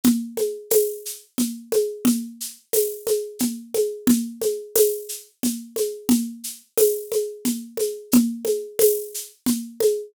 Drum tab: TB |--x---|--x---|--x---|--x---|
SH |xxxxxx|xxxxxx|xxxxxx|xxxxxx|
CG |Ooo-Oo|O-ooOo|Ooo-Oo|O-ooOo|

TB |--x---|
SH |xxxxxx|
CG |Ooo-Oo|